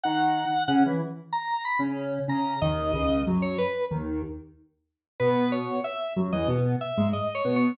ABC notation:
X:1
M:4/4
L:1/16
Q:1/4=93
K:E
V:1 name="Lead 1 (square)"
f4 f z3 ^a2 b z3 a2 | d4 z c B2 z8 | B2 c2 e2 z d z2 e2 (3d2 c2 c2 |]
V:2 name="Lead 1 (square)"
[D,D]3 z [C,C] [E,E] z5 [C,C]3 [C,C]2 | [D,,D,]2 [C,,C,]2 [F,,F,]2 z2 [D,,D,]2 z6 | [B,,B,]4 z2 [F,,F,] [E,,E,] [B,,B,]2 z [G,,G,] z2 [B,,B,]2 |]